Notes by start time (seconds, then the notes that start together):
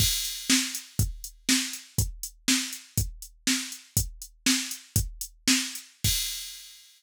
0.00 kick, crash
0.25 closed hi-hat
0.50 snare
0.75 closed hi-hat
0.99 kick, closed hi-hat
1.24 closed hi-hat
1.49 snare
1.73 closed hi-hat
1.98 kick, closed hi-hat
2.23 closed hi-hat
2.48 snare
2.73 closed hi-hat
2.98 kick, closed hi-hat
3.22 closed hi-hat
3.47 snare
3.72 closed hi-hat
3.97 kick, closed hi-hat
4.22 closed hi-hat
4.46 snare
4.71 closed hi-hat
4.96 kick, closed hi-hat
5.21 closed hi-hat
5.48 snare
5.75 closed hi-hat
6.04 kick, crash